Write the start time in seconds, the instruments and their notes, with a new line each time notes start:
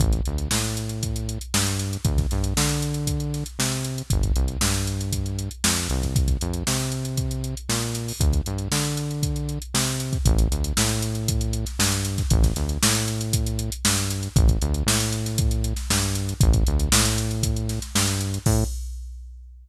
0.00 synth bass 1 A1, kick, closed hi-hat
0.13 kick, closed hi-hat
0.25 synth bass 1 D2, closed hi-hat
0.38 closed hi-hat
0.51 synth bass 1 A2, snare
0.64 closed hi-hat
0.77 closed hi-hat
0.89 closed hi-hat
1.03 kick, closed hi-hat
1.16 closed hi-hat
1.29 closed hi-hat
1.41 closed hi-hat
1.54 synth bass 1 G2, snare
1.66 snare, closed hi-hat
1.79 snare, closed hi-hat
1.93 closed hi-hat
2.05 synth bass 1 D2, kick, closed hi-hat
2.18 kick, snare, closed hi-hat
2.31 synth bass 1 G2, snare, closed hi-hat
2.44 closed hi-hat
2.57 synth bass 1 D3, snare
2.69 closed hi-hat
2.82 closed hi-hat
2.94 closed hi-hat
3.07 kick, closed hi-hat
3.20 closed hi-hat
3.34 snare, closed hi-hat
3.46 closed hi-hat
3.59 synth bass 1 C3, snare
3.72 snare, closed hi-hat
3.85 closed hi-hat
3.98 closed hi-hat
4.10 synth bass 1 G1, kick, closed hi-hat
4.23 kick, closed hi-hat
4.36 synth bass 1 C2, closed hi-hat
4.48 closed hi-hat
4.61 synth bass 1 G2, snare
4.74 snare, closed hi-hat
4.87 closed hi-hat
5.01 closed hi-hat
5.13 kick, closed hi-hat
5.26 closed hi-hat
5.39 closed hi-hat
5.51 closed hi-hat
5.64 synth bass 1 F2, snare
5.77 closed hi-hat
5.90 synth bass 1 C2, closed hi-hat
6.02 kick, snare, closed hi-hat
6.16 kick, closed hi-hat
6.28 kick, closed hi-hat
6.41 synth bass 1 F2, closed hi-hat
6.54 closed hi-hat
6.67 synth bass 1 C3, snare
6.80 closed hi-hat
6.92 closed hi-hat
7.05 closed hi-hat
7.17 kick, closed hi-hat
7.31 closed hi-hat
7.44 closed hi-hat
7.57 closed hi-hat
7.69 synth bass 1 A#2, snare
7.82 closed hi-hat
7.95 snare, closed hi-hat
8.08 open hi-hat
8.20 synth bass 1 D2, kick, closed hi-hat
8.33 kick, closed hi-hat
8.46 synth bass 1 G2, closed hi-hat
8.58 closed hi-hat
8.71 synth bass 1 D3, snare
8.85 closed hi-hat
8.97 closed hi-hat
9.11 closed hi-hat
9.23 kick, closed hi-hat
9.36 closed hi-hat
9.49 closed hi-hat
9.62 closed hi-hat
9.74 synth bass 1 C3, snare
9.87 closed hi-hat
10.00 closed hi-hat
10.13 kick, closed hi-hat
10.25 synth bass 1 A1, kick, closed hi-hat
10.38 closed hi-hat
10.51 synth bass 1 D2, closed hi-hat
10.64 closed hi-hat
10.77 synth bass 1 A2, snare
10.89 closed hi-hat
11.02 closed hi-hat
11.15 closed hi-hat
11.28 kick, closed hi-hat
11.41 closed hi-hat
11.53 closed hi-hat
11.66 snare, closed hi-hat
11.79 synth bass 1 G2, snare
11.92 closed hi-hat
12.05 closed hi-hat
12.18 kick, snare, closed hi-hat
12.30 synth bass 1 A1, kick, closed hi-hat
12.43 kick, snare, closed hi-hat
12.56 synth bass 1 D2, snare, closed hi-hat
12.69 closed hi-hat
12.83 synth bass 1 A2, snare
12.95 closed hi-hat
13.08 closed hi-hat
13.21 closed hi-hat
13.33 kick, closed hi-hat
13.46 closed hi-hat
13.59 closed hi-hat
13.72 closed hi-hat
13.85 synth bass 1 G2, snare
13.97 closed hi-hat
14.10 closed hi-hat
14.23 closed hi-hat
14.36 synth bass 1 A1, kick, closed hi-hat
14.48 kick, closed hi-hat
14.62 synth bass 1 D2, closed hi-hat
14.74 closed hi-hat
14.86 synth bass 1 A2, snare
15.00 closed hi-hat
15.12 closed hi-hat
15.26 snare, closed hi-hat
15.38 kick, closed hi-hat
15.51 closed hi-hat
15.64 closed hi-hat
15.76 snare, closed hi-hat
15.90 synth bass 1 G2, snare
16.02 closed hi-hat
16.15 closed hi-hat
16.29 closed hi-hat
16.40 synth bass 1 A1, kick, closed hi-hat
16.53 kick, closed hi-hat
16.67 synth bass 1 D2, closed hi-hat
16.79 closed hi-hat
16.92 synth bass 1 A2, snare
17.05 closed hi-hat
17.18 closed hi-hat
17.31 closed hi-hat
17.43 kick, closed hi-hat
17.56 closed hi-hat
17.69 snare, closed hi-hat
17.82 snare, closed hi-hat
17.95 synth bass 1 G2, snare
18.07 closed hi-hat
18.21 closed hi-hat
18.34 closed hi-hat
18.46 synth bass 1 A2, kick, crash